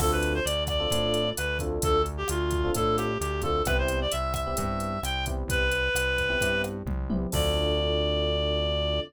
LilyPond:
<<
  \new Staff \with { instrumentName = "Clarinet" } { \time 4/4 \key d \dorian \tempo 4 = 131 a'16 b'8 c''16 d''8 d''4. b'8 r8 | a'8 r16 g'16 f'4 a'8 g'8 g'8 a'8 | b'16 c''8 d''16 e''8 e''4. g''8 r8 | b'2~ b'8 r4. |
d''1 | }
  \new Staff \with { instrumentName = "Electric Piano 1" } { \time 4/4 \key d \dorian <c' d' f' a'>4.~ <c' d' f' a'>16 <c' d' f' a'>16 <c' d' f' a'>4. <c' d' f' a'>8~ | <c' d' f' a'>4.~ <c' d' f' a'>16 <c' d' f' a'>16 <c' d' f' a'>4. <c' d' f' a'>8 | <b c' e' g'>4.~ <b c' e' g'>16 <b c' e' g'>16 <b c' e' g'>4. <b c' e' g'>8~ | <b c' e' g'>4.~ <b c' e' g'>16 <b c' e' g'>16 <b c' e' g'>4. <b c' e' g'>8 |
<c' d' f' a'>1 | }
  \new Staff \with { instrumentName = "Synth Bass 1" } { \clef bass \time 4/4 \key d \dorian d,4 d,4 a,4 d,4 | d,4 d,4 a,4 d,4 | c,4 c,4 g,4 c,4 | c,4 c,4 g,4 c,4 |
d,1 | }
  \new DrumStaff \with { instrumentName = "Drums" } \drummode { \time 4/4 <cymc bd ss>8 hh8 hh8 <hh bd ss>8 <hh bd>8 hh8 <hh ss>8 <hh bd>8 | <hh bd>8 hh8 <hh ss>8 <hh bd>8 <hh bd>8 <hh ss>8 hh8 <hh bd>8 | <hh bd ss>8 hh8 hh8 <hh bd ss>8 <hh bd>8 hh8 <hh ss>8 <hh bd>8 | <hh bd>8 hh8 <hh ss>8 <hh bd>8 <hh bd>8 <hh ss>8 <bd tommh>8 tommh8 |
<cymc bd>4 r4 r4 r4 | }
>>